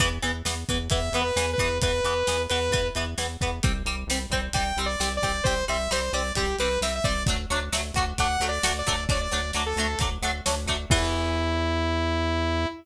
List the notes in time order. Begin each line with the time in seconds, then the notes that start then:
0.00 E2 E3 B3, kick, closed hi-hat
0.22 E2 E3 B3, closed hi-hat
0.45 E2 E3 B3, snare
0.69 E2 E3 B3, kick, closed hi-hat
0.90 E2 E3 B3 E5, kick, closed hi-hat
1.12 E2 E3 B3, closed hi-hat
1.21 B4
1.36 E2 E3 B3, snare
1.53 B4
1.58 E2 E3 B3, kick, closed hi-hat
1.81 E2 E3 B3 B4, kick, closed hi-hat
2.04 E2 E3 B3, closed hi-hat
2.27 E2 E3 B3, snare
2.49 E2 E3 B3 B4, closed hi-hat
2.71 E2 E3 B3, kick, closed hi-hat
2.95 E2 E3 B3, closed hi-hat
3.18 E2 E3 B3, snare
3.41 E2 E3 B3, kick, closed hi-hat
3.63 C2 G3 C4, kick, closed hi-hat
3.85 C2 G3 C4, closed hi-hat
4.07 C2 G3 C4, snare
4.30 C2 G3 C4, kick, closed hi-hat
4.53 C2 G3 C4 G5, kick, closed hi-hat
4.77 C2 G3 C4, closed hi-hat
4.86 D5
5.00 C2 G3 C4, snare
5.17 D5
5.22 C2 G3 C4, kick, closed hi-hat
5.44 C2 G3 C4 C5, kick, closed hi-hat
5.68 C2 G3 C4 E5, closed hi-hat
5.91 C2 G3 C4 C5, snare
6.13 C2 G3 C4 D5, closed hi-hat
6.35 C2 G3 C4 G4, kick, closed hi-hat
6.59 C2 G3 C4 B4, closed hi-hat
6.81 C2 G3 C4 E5, snare
6.95 E5
7.04 C2 G3 C4 D5, kick, closed hi-hat
7.26 D2 F#3 A3 D4, kick, closed hi-hat
7.50 D2 F#3 A3 D4, closed hi-hat
7.72 D2 F#3 A3 D4, snare
7.94 D2 F#3 A3 D4, kick, closed hi-hat
8.18 D2 F#3 A3 D4 F#5, kick, closed hi-hat
8.40 D2 F#3 A3 D4, closed hi-hat
8.48 D5
8.63 D2 F#3 A3 D4, snare
8.79 D5
8.87 D2 F#3 A3 D4, kick, closed hi-hat
9.09 D2 F#3 A3 D4 D5, kick, closed hi-hat
9.21 D5
9.31 D2 F#3 A3 D4, closed hi-hat
9.53 D2 F#3 A3 D4, snare
9.66 A4
9.76 D2 F#3 A3 D4, closed hi-hat
9.99 D2 F#3 A3 D4, kick, closed hi-hat
10.22 D2 F#3 A3 D4, closed hi-hat
10.46 D2 F#3 A3 D4, snare
10.66 D2 F#3 A3 D4, kick, closed hi-hat
10.90 E2 E3 B3 E4, kick, crash